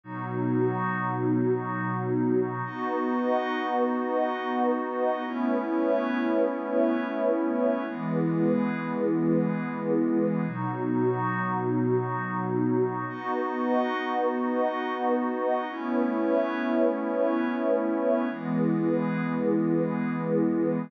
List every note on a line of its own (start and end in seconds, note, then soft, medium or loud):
0.03 2.62 B2 medium
0.03 2.62 F#3 medium
0.03 2.62 B3 medium
0.03 2.62 D#4 medium
0.03 2.62 F#4 medium
2.65 5.23 B3 medium
2.65 5.23 D#4 medium
2.65 5.23 F#4 medium
2.65 5.23 B4 medium
2.65 5.23 D#5 medium
2.65 5.23 F#5 medium
5.26 7.84 A3 medium
5.26 7.84 B3 medium
5.26 7.84 C#4 medium
5.26 7.84 E4 medium
5.26 7.84 B4 medium
5.26 7.84 C#5 medium
5.26 7.84 E5 medium
7.87 10.45 E3 medium
7.87 10.45 G#3 medium
7.87 10.45 B3 medium
7.87 10.45 E4 medium
7.87 10.45 G#4 medium
7.87 10.45 B4 medium
10.47 13.05 B2 medium
10.47 13.05 F#3 medium
10.47 13.06 B3 medium
10.47 13.05 D#4 medium
10.47 13.06 D#4 medium
10.47 13.06 F#4 medium
13.08 15.66 B3 medium
13.08 15.66 D#4 medium
13.08 15.66 F#4 medium
13.08 15.67 B4 medium
13.08 15.67 D#5 medium
13.08 15.67 F#5 medium
15.69 18.27 A3 medium
15.69 18.28 A3 medium
15.69 18.28 B3 medium
15.69 18.28 C#4 medium
15.69 18.28 E4 medium
15.69 18.27 B4 medium
15.69 18.27 C#5 medium
15.69 18.27 E5 medium
18.30 20.89 E3 medium
18.30 20.89 G#3 medium
18.30 20.89 B3 medium
18.30 20.88 E4 medium
18.30 20.88 G#4 medium
18.30 20.88 B4 medium